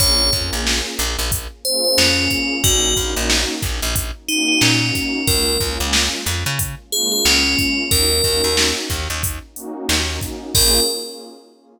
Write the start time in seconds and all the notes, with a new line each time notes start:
0.00 A#1 A#3 C#4 F4 G#4 C#5, kick, closed hi-hat
0.20 A#3 C#4 F4 G#4
0.32 F2 A#3 C#4 F4 G#4, kick, closed hi-hat
0.53 A#1
0.67 snare
0.99 A#1, snare, closed hi-hat
1.19 A#1
1.32 kick, closed hi-hat
1.65 A#3 C#4 F4 G#4 C5, closed hi-hat
1.85 C5
1.98 F2 C#4, snare
2.18 A#3 C#4 F4 G#4
2.30 kick, closed hi-hat
2.64 A#1 A#3 C#4 D#4 F#4, kick, closed hi-hat
2.84 A#3 C#4 D#4 F#4
2.96 A#1 A#3 C#4 D#4 F#4, kick, closed hi-hat
3.16 A#1
3.30 snare
3.62 A#1, kick, snare, closed hi-hat
3.82 A#1
3.96 kick, closed hi-hat
4.28 A#3 C#4 D#4 F#4, closed hi-hat
4.48 D#4
4.61 A#2 C#4, snare
4.82 A#3 C#4 D#4 F#4
4.95 kick, snare, closed hi-hat
5.26 C#2 G#3 A#3 C#4 F4 A#4, kick, closed hi-hat
5.47 G#3 A#3 C#4 F4
5.60 C#2 G#3 A#3 C#4 F4, kick, closed hi-hat
5.80 C#2
5.93 snare
6.26 F2, snare, closed hi-hat
6.46 C#3
6.59 kick, closed hi-hat
6.91 G#3 A#3 C#4 F4 G#4, closed hi-hat
7.12 G#4
7.25 C#2 C#4, snare
7.45 G#3 A#3 C#4 F4
7.59 kick, closed hi-hat
7.90 D#2 A#3 C#4 D#4 F#4 A#4, kick, closed hi-hat
8.11 A#3 C#4 D#4 F#4
8.24 D#2 A#3 C#4 D#4 F#4, kick, closed hi-hat
8.44 D#2
8.57 snare
8.90 D#2, kick, snare, closed hi-hat
9.10 D#2
9.23 kick, closed hi-hat
9.55 A#3 C#4 D#4 F#4, closed hi-hat
9.89 D#2, snare
10.08 A#3 C#4 D#4 F#4
10.21 kick, closed hi-hat
10.55 A#1 A#3 C#4 F4 G#4 A#4, kick, crash